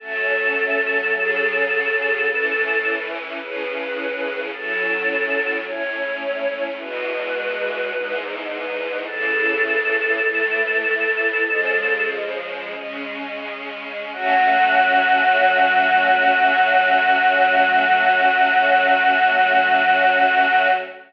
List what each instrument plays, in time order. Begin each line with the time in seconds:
0.00 string ensemble 1 F#3 A3 C#4, choir aahs A4
1.14 string ensemble 1 C#3 F#3 C#4
2.27 string ensemble 1 A2 E3 C#4
3.39 string ensemble 1 A2 C#3 C#4, choir aahs B4
4.52 string ensemble 1 A2 F#3 C#4, choir aahs A4
5.66 string ensemble 1 A2 A3 C#4, choir aahs C#5
6.79 string ensemble 1 E2 B2 G#3, choir aahs B4
7.92 string ensemble 1 E2 G#2 G#3
8.49 choir aahs B4
9.05 string ensemble 1 A2 C#3 E3, choir aahs A4
10.21 string ensemble 1 A2 E3 A3
11.46 string ensemble 1 C#3 F3 G#3
12.74 string ensemble 1 C#3 G#3 C#4
14.12 string ensemble 1 F#3 A3 C#4, choir aahs F#4